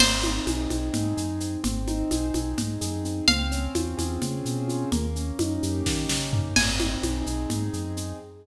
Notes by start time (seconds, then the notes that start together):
0.00 G#1 C4 C5, crash, low conga, shaker
0.23 D#4, high conga, shaker
0.46 B1 G#4, high conga, shaker
0.70 B1 C4, high conga, shaker
0.93 G#2 D#4, low conga, shaker
1.17 F#2 G#4, shaker
1.40 C4, shaker
1.64 G#1 C4, low conga, shaker
1.87 D#4, high conga, shaker
2.11 B1 G#4, high conga, shaker
2.34 B1 C4, high conga, shaker
2.58 G#2 D#4, low conga, shaker
2.81 F#2 G#4, shaker
3.04 C4, shaker
3.28 C#2 C4 F5, low conga, shaker
3.51 C#4, shaker
3.75 E2 F4, high conga, shaker
3.97 E2 G#4, high conga, shaker
4.22 C#3 C4, low conga, shaker
4.44 B2 C#4, shaker
4.68 F4, shaker
4.92 D#2 A#3, low conga, shaker
5.16 C#4, shaker
5.39 F#2 D#4, high conga, shaker
5.62 F#2 G4, shaker
5.86 D#3 A#3, kick, snare
6.09 C#3 C#4, snare
6.33 D#4, floor tom
6.56 G#1 C4 G#5, crash, low conga, shaker
6.80 D#4, high conga, shaker
7.03 B1 G#4, high conga, shaker
7.26 B1 C4, shaker
7.50 G#2 D#4, low conga, shaker
7.73 F#2 G#4, shaker
7.97 C4, shaker